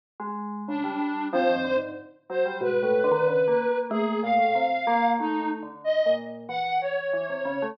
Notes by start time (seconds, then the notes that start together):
0.20 G#3
0.68 C#3 D4
0.84 G3
0.99 G3
1.33 F3 C4 C5
1.49 D#3
1.56 F2
1.64 D3
1.76 G#2
2.29 F#3 C5
2.46 G3
2.61 G#2 B2 B4
2.83 A2
3.04 D3
3.11 D#3
3.27 C#3
3.48 A#3
3.69 A#3
3.90 A3 A#3 G#4
4.23 A#2 F5
4.39 A2
4.55 C3
4.87 A#3
5.19 D#2 A3 D#4
5.62 D3
5.84 D#5
6.06 A#2
6.49 E3 F#5
6.81 C#5
7.13 E3
7.30 C3
7.45 C#3
7.62 A3